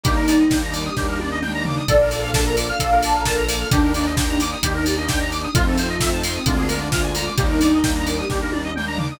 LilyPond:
<<
  \new Staff \with { instrumentName = "Ocarina" } { \time 4/4 \key bes \major \tempo 4 = 131 ees'4. bes'16 g'16 g'4 r4 | d''8 a'8. bes'16 r16 f''8. a''16 bes''16 bes'8 bes'16 r16 | d'8 d'8. d'16 r16 ees'8. g'16 bes'16 d'8 d'16 r16 | c'8 f'8. ees'16 r16 c'8. d'16 d'16 f'8 f'16 r16 |
ees'4. bes'16 g'16 g'4 r4 | }
  \new Staff \with { instrumentName = "Lead 2 (sawtooth)" } { \time 4/4 \key bes \major <g bes d' ees'>4 <g bes d' ees'>4 <g bes d' ees'>4 <g bes d' ees'>4 | <bes d' f' a'>4 <bes d' f' a'>4 <bes d' f' a'>4 <bes d' f' a'>4 | <bes d' ees' g'>4 <bes d' ees' g'>4 <bes d' ees' g'>4 <bes d' ees' g'>4 | <a c' ees' f'>4 <a c' ees' f'>4 <aes bes d' f'>4 <aes bes d' f'>4 |
<g bes d' ees'>4 <g bes d' ees'>4 <g bes d' ees'>4 <g bes d' ees'>4 | }
  \new Staff \with { instrumentName = "Lead 1 (square)" } { \time 4/4 \key bes \major g'16 bes'16 d''16 ees''16 g''16 bes''16 d'''16 ees'''16 g'16 bes'16 d''16 ees''16 g''16 bes''16 d'''16 ees'''16 | a'16 bes'16 d''16 f''16 a''16 bes''16 d'''16 f'''16 a'16 bes'16 d''16 f''16 a''16 bes''16 d'''16 f'''16 | g'16 bes'16 d''16 ees''16 g''16 bes''16 d'''16 ees'''16 g'16 bes'16 d''16 ees''16 g''16 bes''16 d'''16 ees'''16 | f'16 a'16 c''16 ees''16 e''16 a''16 c'''16 ees'''16 f'16 aes'16 bes'16 d''16 f''16 aes''16 bes''16 d'''16 |
g'16 bes'16 d''16 ees''16 g''16 bes''16 d'''16 ees'''16 g'16 bes'16 d''16 ees''16 g''16 bes''16 d'''16 ees'''16 | }
  \new Staff \with { instrumentName = "Synth Bass 1" } { \clef bass \time 4/4 \key bes \major ees,2 ees,2 | bes,,2 bes,,2 | ees,2 ees,2 | f,2 d,2 |
ees,2 ees,2 | }
  \new Staff \with { instrumentName = "Pad 5 (bowed)" } { \time 4/4 \key bes \major <g bes d' ees'>1 | <bes d' f' a'>1 | <bes d' ees' g'>1 | <a c' ees' f'>2 <aes bes d' f'>2 |
<g bes d' ees'>1 | }
  \new DrumStaff \with { instrumentName = "Drums" } \drummode { \time 4/4 <hh bd>8 hho8 <bd sn>8 hho8 <bd sn>8 tommh8 toml8 tomfh8 | <hh bd>8 hho8 <bd sn>8 hho8 <hh bd>8 hho8 <bd sn>8 hho8 | <hh bd>8 hho8 <bd sn>8 hho8 <hh bd>8 hho8 <bd sn>8 hho8 | <hh bd>8 hho8 <bd sn>8 hho8 <hh bd>8 hho8 <bd sn>8 hho8 |
<hh bd>8 hho8 <bd sn>8 hho8 <bd sn>8 tommh8 toml8 tomfh8 | }
>>